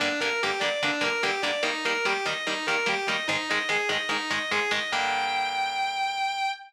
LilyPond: <<
  \new Staff \with { instrumentName = "Distortion Guitar" } { \time 4/4 \key g \phrygian \tempo 4 = 146 d'8 bes'8 g'8 d''8 d'8 bes'8 g'8 d''8 | ees'8 bes'8 g'8 ees''8 ees'8 bes'8 g'8 ees''8 | ees'8 ees''8 aes'8 ees''8 ees'8 ees''8 aes'8 ees''8 | g''1 | }
  \new Staff \with { instrumentName = "Overdriven Guitar" } { \time 4/4 \key g \phrygian <g, d bes>8 <g, d bes>8 <g, d bes>8 <g, d bes>8 <g, d bes>8 <g, d bes>8 <g, d bes>8 <g, d bes>8 | <ees g bes>8 <ees g bes>8 <ees g bes>8 <ees g bes>8 <ees g bes>8 <ees g bes>8 <ees g bes>8 <ees g bes>8 | <aes, ees aes>8 <aes, ees aes>8 <aes, ees aes>8 <aes, ees aes>8 <aes, ees aes>8 <aes, ees aes>8 <aes, ees aes>8 <aes, ees aes>8 | <g, d bes>1 | }
>>